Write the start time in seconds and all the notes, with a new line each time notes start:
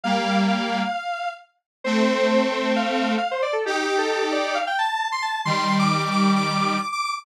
0.03 G3 A#3 F5
0.48 F5
1.84 A3 C4 C5
2.52 C5
2.76 F5
3.18 F5
3.31 C5
3.42 D5
3.53 A4
3.65 D#4 G4
3.98 A4
4.32 D5
4.55 F5
4.67 G5
4.79 A5
5.12 C6
5.22 A5
5.45 D#3 G3 C6
5.79 D6
6.11 D6
6.36 D6
6.47 D6
6.59 D6
6.92 D6
7.05 D6